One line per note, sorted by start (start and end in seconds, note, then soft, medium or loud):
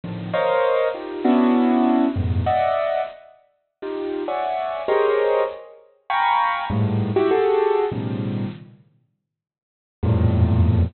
0.04 0.31 A2 medium
0.04 0.31 A#2 medium
0.04 0.31 C3 medium
0.04 0.31 D3 medium
0.04 0.31 D#3 medium
0.04 0.31 F3 medium
0.33 0.88 A#4 loud
0.33 0.88 C5 loud
0.33 0.88 C#5 loud
0.33 0.88 D#5 loud
0.33 0.88 F5 loud
0.94 1.22 D#4 medium
0.94 1.22 F4 medium
0.94 1.22 G4 medium
1.24 2.06 B3 loud
1.24 2.06 C#4 loud
1.24 2.06 D4 loud
1.24 2.06 E4 loud
1.24 2.06 F#4 loud
2.16 2.43 F2 medium
2.16 2.43 G2 medium
2.16 2.43 G#2 medium
2.16 2.43 A2 medium
2.16 2.43 B2 medium
2.46 3.01 D5 medium
2.46 3.01 D#5 medium
2.46 3.01 E5 medium
2.46 3.01 F#5 medium
3.82 4.23 D#4 medium
3.82 4.23 F4 medium
3.82 4.23 G4 medium
4.28 4.82 C#5 medium
4.28 4.82 D5 medium
4.28 4.82 E5 medium
4.28 4.82 F#5 medium
4.28 4.82 G#5 medium
4.88 5.43 G4 medium
4.88 5.43 G#4 medium
4.88 5.43 A#4 medium
4.88 5.43 C5 medium
4.88 5.43 C#5 medium
4.88 5.43 D#5 medium
6.10 6.64 F5 medium
6.10 6.64 G5 medium
6.10 6.64 G#5 medium
6.10 6.64 A#5 medium
6.10 6.64 B5 medium
6.10 6.64 C#6 medium
6.70 7.11 G2 loud
6.70 7.11 G#2 loud
6.70 7.11 A2 loud
7.16 7.30 E4 loud
7.16 7.30 F#4 loud
7.16 7.30 G4 loud
7.31 7.86 F#4 loud
7.31 7.86 G4 loud
7.31 7.86 G#4 loud
7.31 7.86 A4 loud
7.92 8.46 A2 medium
7.92 8.46 B2 medium
7.92 8.46 C#3 medium
7.92 8.46 D#3 medium
7.92 8.46 F3 medium
7.92 8.46 G3 medium
10.03 10.85 E2 loud
10.03 10.85 F2 loud
10.03 10.85 G2 loud
10.03 10.85 A2 loud
10.03 10.85 A#2 loud